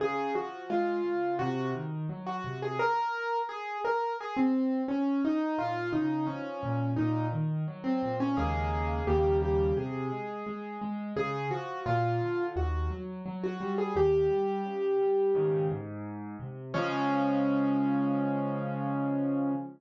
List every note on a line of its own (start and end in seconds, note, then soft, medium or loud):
0.00 0.31 C#3 medium
0.00 0.31 G#4 medium
0.35 0.66 F3 medium
0.35 0.63 F#4 medium
0.70 1.01 G#3 medium
0.70 1.35 F4 medium
1.05 1.36 C#3 medium
1.39 1.71 C3 medium
1.39 1.68 F#4 medium
1.74 2.06 D#3 medium
2.09 2.41 F#3 medium
2.26 2.59 F#4 medium
2.44 2.76 C3 medium
2.62 2.79 G#4 medium
2.79 3.38 A#4 medium
3.49 3.78 G#4 medium
3.85 4.13 A#4 medium
4.20 4.37 G#4 medium
4.37 4.81 C4 medium
4.88 5.21 C#4 medium
5.25 5.58 D#4 medium
5.58 5.90 A#2 medium
5.58 5.89 F4 medium
5.92 6.24 C#3 medium
5.92 6.26 D#4 medium
6.27 6.59 F3 medium
6.27 6.91 C#4 medium
6.63 6.94 A#2 medium
6.96 7.29 A#2 medium
6.96 7.25 D#4 medium
7.32 7.64 D#3 medium
7.68 7.99 F#3 medium
7.84 8.16 C4 medium
8.02 8.34 A#2 medium
8.20 8.37 C#4 medium
8.37 9.00 D#2 medium
8.37 9.00 C#3 medium
8.37 9.00 G#3 medium
8.37 9.00 A#3 medium
8.37 9.04 G#4 medium
9.07 9.70 D#2 medium
9.07 9.70 C#3 medium
9.07 9.70 G3 medium
9.07 9.70 A#3 medium
9.07 9.37 G4 medium
9.42 9.75 G4 medium
9.77 10.08 C3 medium
9.77 10.77 G#4 medium
10.12 10.43 G#3 medium
10.47 10.78 G#3 medium
10.81 11.13 G#3 medium
11.16 11.48 C#3 medium
11.16 11.45 G#4 medium
11.51 11.82 F3 medium
11.51 11.79 F#4 medium
11.86 12.17 A#2 medium
11.86 12.43 F4 medium
12.21 12.52 D3 medium
12.56 12.87 D#2 medium
12.56 12.91 F#4 medium
12.91 13.22 F#3 medium
13.26 13.57 F#3 medium
13.44 13.73 F#4 medium
13.60 13.92 G3 medium
13.78 13.95 G#4 medium
13.95 14.27 D#2 medium
13.95 15.66 G4 medium
14.30 14.61 G3 medium
14.65 14.96 C#3 medium
15.00 15.32 G3 medium
15.35 15.68 G#2 medium
15.35 15.68 C#3 medium
15.35 15.68 D#3 medium
15.70 16.36 G#2 medium
16.40 16.71 C3 medium
16.74 19.52 C#3 loud
16.74 19.52 F3 loud
16.74 19.52 G#3 loud
16.74 19.52 C#4 loud